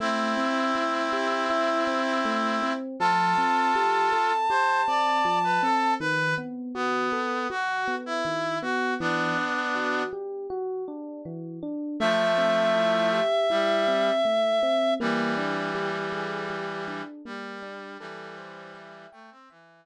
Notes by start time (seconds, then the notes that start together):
0.00 A3 C4 E4
0.37 C4
0.75 E4
1.12 G4
1.50 E4
1.87 C4
2.25 A3
2.62 C4
3.00 F3 F4 A4 A5
3.38 C4
3.75 G4
4.12 A4
4.50 G4 C5
4.87 C4 D5
5.25 F3
5.44 B4
5.63 C4 A4
6.00 D#3 B4
6.38 B3
6.75 B3 F#4
7.12 A4
7.50 F#4
7.88 B3
8.06 E4
8.25 D#3
8.62 B3 F#4
9.00 E3 B3 D4
9.38 D4
9.75 F#4
10.13 G4
10.50 F#4
10.88 D4
11.25 E3
11.63 D4
12.00 F3 A3 E5
12.38 C4
12.75 E4
13.12 G4
13.50 G3 E4
13.88 C4
14.25 A3
14.63 C4
15.00 E3 G3 A#3
15.38 D4
15.75 G4
16.12 G#4
16.50 G4
16.88 D4
17.25 G3 A#3
17.62 D4
17.99 E3 G3 A4
18.38 C5
18.75 E5
19.12 A3 G5
19.31 C4
19.50 E3 E5